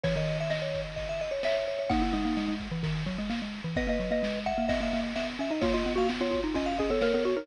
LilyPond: <<
  \new Staff \with { instrumentName = "Xylophone" } { \time 4/4 \key gis \minor \tempo 4 = 129 cis''4 dis''2 e''4 | fis''1 | dis''16 dis''8 dis''16 r8 fis''8 dis''4. r8 | eis'16 eis'8 fis'16 r16 eis'16 eis'8 eis'8 gis'16 a'16 ais'16 ais'16 fis'16 ais'16 | }
  \new Staff \with { instrumentName = "Vibraphone" } { \time 4/4 \key gis \minor cis''16 dis''8 e''16 r16 cis''8 r16 dis''16 e''16 dis''16 cis''16 cis''16 cis''16 cis''16 cis''16 | dis'16 e'16 dis'4 r2 r8 | <b' dis''>4. e''8 e''16 e''8 r16 e''16 r16 e''16 dis''16 | cis''16 dis''8 eis''16 r16 cis''8 r16 dis''16 eis''16 dis''16 cis''16 cis''16 cis''16 cis''16 cis''16 | }
  \new Staff \with { instrumentName = "Xylophone" } { \time 4/4 \key gis \minor e16 dis2~ dis8. r4 | ais8 gis16 ais16 gis16 gis8 e16 dis8 fis16 gis16 ais16 gis8 e16 | b16 ais16 fis16 ais16 gis8. ais16 b16 ais16 ais8 b8 cis'16 dis'16 | ais8 b16 ais16 b16 b8 dis'16 cis'8 cis'16 b16 ais16 b8 dis'16 | }
  \new DrumStaff \with { instrumentName = "Drums" } \drummode { \time 4/4 <bd cymr>8 cymr8 sn8 <bd cymr>8 <bd cymr>8 cymr8 sn8 cymr8 | <bd cymr>8 cymr8 sn8 <bd cymr>8 <bd cymr>8 <bd cymr>8 sn8 cymr8 | <bd cymr>8 cymr8 sn8 <bd cymr>8 <bd cymr>8 cymr8 sn8 cymr8 | <bd cymr>8 cymr8 sn8 <bd cymr>8 <bd cymr>8 <bd cymr>8 sn8 cymr8 | }
>>